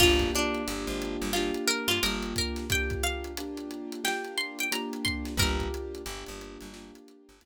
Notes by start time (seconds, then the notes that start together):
0.00 G1 A#3 D4 F4 G4, kick, crash
0.19 kick, closed hi-hat
0.35 D4, closed hi-hat
0.54 closed hi-hat
0.67 G1 A#3 D4 F4 G4, closed hi-hat
0.87 G#1, closed hi-hat
1.02 closed hi-hat
1.21 G1, closed hi-hat
1.33 A#3 D4 F4 G4, snare
1.54 closed hi-hat
1.68 A#4, closed hi-hat
1.88 G2 F4, closed hi-hat
2.02 G1 A#3 D4 F4 G4 A#4, closed hi-hat
2.22 closed hi-hat
2.36 A#4, kick, closed hi-hat
2.56 snare, closed hi-hat
2.70 A#3 D4 F4 G4 G5, kick, closed hi-hat
2.90 kick, closed hi-hat
3.03 F5, closed hi-hat
3.24 closed hi-hat
3.37 A#3 D4 F4 G4, closed hi-hat
3.57 closed hi-hat
3.71 closed hi-hat
3.92 closed hi-hat
4.04 A#3 D4 F4 G4 G5, snare
4.24 closed hi-hat
4.37 C6, closed hi-hat
4.59 G5, closed hi-hat
4.71 A#3 D4 F4 G4 A#5, closed hi-hat
4.93 closed hi-hat
5.05 C6, kick, closed hi-hat
5.25 snare, closed hi-hat
5.37 G1 A#3 D4 F4 G4 A#4, kick, closed hi-hat
5.60 kick, closed hi-hat
5.74 closed hi-hat
5.95 closed hi-hat
6.06 G1 A#3 D4 F4 G4, closed hi-hat
6.26 G1, closed hi-hat
6.41 closed hi-hat
6.61 G1, closed hi-hat
6.73 A#3 D4 F4 G4, snare
6.95 closed hi-hat
7.08 closed hi-hat
7.29 G1, closed hi-hat
7.41 D2 A#3 D4 F4 G4, closed hi-hat